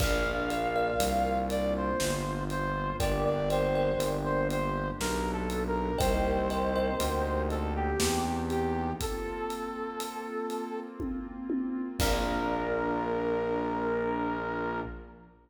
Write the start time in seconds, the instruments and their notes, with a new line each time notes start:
0.00 synth bass 1 A#1, pad 2 (warm) A#3 D4 F4, kalimba A#4 D5 F5, lead 2 (sawtooth) F5, kick, crash
0.50 kalimba A#4 D5 F5, closed hi-hat
0.76 kalimba A#4 D5 F5
1.00 synth bass 1 C2, closed hi-hat
1.50 lead 2 (sawtooth) D5, closed hi-hat
1.76 lead 2 (sawtooth) C5
2.00 synth bass 1 G1, snare
2.50 lead 2 (sawtooth) C5, closed hi-hat
2.99 synth bass 1 G1, pad 2 (warm) A#3 D4 G4, kalimba A#4 D5 G5, lead 2 (sawtooth) D5, kick, closed hi-hat
3.25 lead 2 (sawtooth) D5
3.50 kalimba A#4 D5 G5, lead 2 (sawtooth) C5, closed hi-hat
3.75 kalimba A#4 D5 G5
3.99 synth bass 1 G1, closed hi-hat
4.24 lead 2 (sawtooth) C5
4.50 lead 2 (sawtooth) C5, closed hi-hat
5.00 synth bass 1 B1, lead 2 (sawtooth) A#4, snare
5.32 lead 2 (sawtooth) A4
5.50 closed hi-hat
5.67 lead 2 (sawtooth) A#4
5.98 synth bass 1 C2, pad 2 (warm) A#3 C4 D#4 G4, kalimba A#4 C5 D#5 G5, lead 2 (sawtooth) C5, kick, closed hi-hat
6.50 kalimba A#4 C5 D#5 G5, closed hi-hat
6.76 kalimba A#4 C5 D#5 G5
7.00 synth bass 1 D2, closed hi-hat
7.50 lead 2 (sawtooth) A4, closed hi-hat
7.75 lead 2 (sawtooth) G4
8.00 synth bass 1 E2, snare
8.50 lead 2 (sawtooth) G4, closed hi-hat
9.00 pad 2 (warm) A#3 C4 F4, lead 2 (sawtooth) A4, kick, closed hi-hat
9.50 closed hi-hat
10.00 closed hi-hat
10.50 closed hi-hat
11.00 kick, high tom
11.50 high tom
11.99 synth bass 1 A#1, pad 2 (warm) A#3 D4 F4, lead 2 (sawtooth) A#4, kalimba A#4 D5 F5, kick, crash